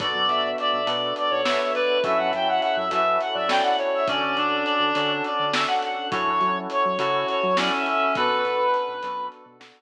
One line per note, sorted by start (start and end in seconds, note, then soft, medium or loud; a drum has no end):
0.00 0.13 B1 medium
0.00 0.81 B3 loud
0.00 2.02 B3 medium
0.00 0.81 D4 loud
0.00 2.02 D4 medium
0.00 0.81 F#4 loud
0.00 2.02 F#4 medium
0.00 0.81 A4 loud
0.00 2.02 A4 loud
0.00 0.49 D5 medium
0.00 0.26 D5 medium
0.00 kick loud
0.00 closed hi-hat loud
0.15 0.28 F#2 medium
0.28 0.55 B1 medium
0.28 0.54 E5 medium
0.28 closed hi-hat medium
0.58 1.14 D5 medium
0.58 0.85 E5 medium
0.58 closed hi-hat medium
0.73 0.86 B1 medium
0.87 1.13 B2 medium
0.87 1.40 B3 medium
0.87 1.40 D4 loud
0.87 1.40 F#4 medium
0.87 1.40 A4 loud
0.87 closed hi-hat loud
1.16 1.41 D5 medium
1.16 closed hi-hat medium
1.31 1.58 B1 medium
1.31 1.70 C#5 medium
1.44 1.99 B3 loud
1.44 1.99 D4 loud
1.44 1.99 F#4 medium
1.44 1.99 A4 loud
1.44 1.58 E5 medium
1.44 snare loud
1.59 1.73 E5 medium
1.74 2.01 B4 loud
1.74 1.98 D5 medium
1.74 closed hi-hat medium
2.03 2.18 F#2 medium
2.03 4.05 C#4 medium
2.03 2.85 C#4 loud
2.03 4.05 E4 loud
2.03 2.85 E4 loud
2.03 4.05 F#4 loud
2.03 2.85 F#4 loud
2.03 4.05 A4 loud
2.03 2.85 A4 loud
2.03 2.17 E5 medium
2.03 2.32 E5 medium
2.03 kick loud
2.03 closed hi-hat medium
2.17 2.32 F#2 medium
2.17 2.31 F#5 medium
2.33 2.60 F#2 medium
2.33 2.59 E5 medium
2.33 2.48 G5 medium
2.33 closed hi-hat medium
2.48 2.61 F#5 medium
2.62 2.87 E5 medium
2.62 2.76 F#5 medium
2.62 closed hi-hat medium
2.77 2.90 F#2 medium
2.77 2.91 E5 medium
2.91 3.18 F#2 medium
2.91 3.45 C#4 medium
2.91 3.45 E4 medium
2.91 3.45 F#4 loud
2.91 3.45 A4 loud
2.91 3.19 E5 medium
2.91 closed hi-hat loud
3.21 3.35 F#5 medium
3.21 closed hi-hat medium
3.34 3.61 F#2 medium
3.34 3.72 D5 medium
3.34 3.49 E5 medium
3.48 4.01 C#4 loud
3.48 4.01 E4 loud
3.48 4.01 F#4 loud
3.48 4.01 A4 loud
3.48 3.63 G5 medium
3.48 snare loud
3.63 3.77 F#5 medium
3.79 4.06 C#5 medium
3.79 closed hi-hat medium
3.95 4.08 E5 medium
4.07 4.21 D2 medium
4.07 6.10 C#4 loud
4.07 4.35 C#4 medium
4.07 4.89 C#4 loud
4.07 6.10 D4 medium
4.07 4.89 D4 loud
4.07 6.10 F#4 medium
4.07 4.89 F#4 loud
4.07 6.10 A4 loud
4.07 4.89 A4 loud
4.07 4.63 D5 medium
4.07 kick loud
4.07 closed hi-hat loud
4.23 4.36 D2 medium
4.37 4.64 D2 medium
4.37 5.22 D4 medium
4.37 closed hi-hat medium
4.64 5.12 D5 medium
4.64 closed hi-hat medium
4.80 4.93 D2 medium
4.95 5.22 D3 medium
4.95 5.50 C#4 medium
4.95 5.50 D4 medium
4.95 5.50 F#4 loud
4.95 5.50 A4 loud
4.95 closed hi-hat loud
5.24 5.53 D5 medium
5.24 closed hi-hat medium
5.39 5.66 D3 medium
5.53 6.07 C#4 medium
5.53 6.07 D4 loud
5.53 6.07 F#4 loud
5.53 6.07 A4 loud
5.53 5.67 E5 medium
5.53 snare loud
5.67 5.81 F#5 medium
5.83 6.08 F#5 medium
5.83 closed hi-hat medium
6.11 6.25 F#2 medium
6.11 8.14 C#4 loud
6.11 6.93 C#4 loud
6.11 8.14 E4 loud
6.11 6.93 E4 loud
6.11 8.14 F#4 loud
6.11 6.93 F#4 loud
6.11 8.14 A4 medium
6.11 6.93 A4 loud
6.11 6.58 C#5 medium
6.11 kick loud
6.11 closed hi-hat loud
6.27 6.40 F#2 medium
6.41 6.67 F#3 medium
6.41 closed hi-hat medium
6.70 7.26 C#5 medium
6.70 closed hi-hat medium
6.85 6.99 F#3 medium
6.99 7.25 C#3 medium
6.99 7.53 C#4 medium
6.99 7.53 E4 loud
6.99 7.38 F#4 medium
6.99 7.53 F#4 medium
6.99 7.53 A4 loud
6.99 closed hi-hat loud
7.28 7.57 C#5 medium
7.28 closed hi-hat medium
7.43 7.70 F#3 medium
7.57 8.12 C#4 medium
7.57 8.15 C#4 medium
7.57 8.12 E4 loud
7.57 8.12 F#4 loud
7.57 8.12 A4 medium
7.57 7.72 D5 medium
7.57 snare loud
7.74 7.85 E5 medium
7.86 8.13 E5 medium
7.86 closed hi-hat medium
8.15 8.29 B1 medium
8.15 9.82 B3 medium
8.15 8.97 B3 loud
8.15 9.82 D4 loud
8.15 8.97 D4 loud
8.15 9.82 F#4 loud
8.15 8.97 F#4 loud
8.15 8.64 A4 medium
8.15 9.82 A4 medium
8.15 8.97 A4 loud
8.15 9.27 B4 loud
8.15 kick loud
8.15 closed hi-hat medium
8.30 8.43 B1 medium
8.45 8.71 B1 medium
8.45 closed hi-hat medium
8.74 closed hi-hat medium
8.88 9.01 B1 medium
9.03 9.29 F#2 medium
9.03 9.57 B3 loud
9.03 9.57 D4 loud
9.03 9.57 F#4 loud
9.03 9.57 A4 loud
9.03 closed hi-hat loud
9.32 closed hi-hat medium
9.46 9.72 B2 medium
9.60 9.82 B3 loud
9.60 9.82 D4 medium
9.60 9.82 F#4 loud
9.60 9.82 A4 loud
9.60 snare loud